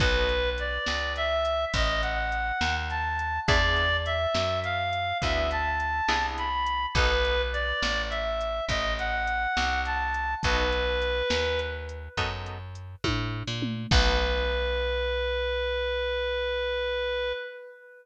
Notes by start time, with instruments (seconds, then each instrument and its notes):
0.00 electric bass (finger) B1, acoustic guitar (steel) B3 D#4 F#4 A4, clarinet B4, kick, closed hi-hat
0.29 closed hi-hat
0.58 clarinet D5, closed hi-hat
0.86 electric bass (finger) C#2, snare
1.16 clarinet E5, closed hi-hat
1.45 closed hi-hat
1.74 electric bass (finger) A1, clarinet D#5, kick, closed hi-hat
2.02 clarinet F#5, closed hi-hat
2.32 closed hi-hat
2.61 electric bass (finger) D#2, snare
2.90 clarinet A5, closed hi-hat
3.19 closed hi-hat
3.47 electric bass (finger) E2, acoustic guitar (steel) B3 D4 E4 G#4, clarinet D5, kick, closed hi-hat
3.76 closed hi-hat
4.06 clarinet E5, closed hi-hat
4.35 electric bass (finger) F#2, snare
4.64 clarinet F5, closed hi-hat
4.93 closed hi-hat
5.22 electric bass (finger) D2, acoustic guitar (steel) B3 D4 E4 G#4, clarinet E5, kick, closed hi-hat
5.51 clarinet A5, closed hi-hat
5.80 closed hi-hat
6.08 electric bass (finger) C2, acoustic guitar (steel) B3 D4 E4 G#4, snare
6.38 clarinet B5, closed hi-hat
6.66 closed hi-hat
6.95 electric bass (finger) B1, acoustic guitar (steel) B3 D#4 F#4 A4, clarinet B4, kick, closed hi-hat
7.25 closed hi-hat
7.53 clarinet D5, closed hi-hat
7.82 electric bass (finger) A1, snare
8.10 clarinet E5, closed hi-hat
8.41 closed hi-hat
8.68 electric bass (finger) A1, clarinet D#5, kick, closed hi-hat
8.99 clarinet F#5, closed hi-hat
9.27 closed hi-hat
9.57 electric bass (finger) C2, snare
9.85 clarinet A5, closed hi-hat
10.14 closed hi-hat
10.43 electric bass (finger) B1, acoustic guitar (steel) B3 D#4 F#4 A4, clarinet B4, kick, closed hi-hat
10.72 closed hi-hat
11.02 closed hi-hat
11.30 electric bass (finger) D#2, snare
11.59 closed hi-hat
11.89 closed hi-hat
12.17 electric bass (finger) F#2, acoustic guitar (steel) B3 D#4 F#4 A4, kick, closed hi-hat
12.46 closed hi-hat
12.75 closed hi-hat
13.04 electric bass (finger) A2, kick, high tom
13.47 electric bass (finger) A#2
13.62 mid tom
13.91 electric bass (finger) B1, acoustic guitar (steel) B3 D#4 F#4 A4, clarinet B4, kick, crash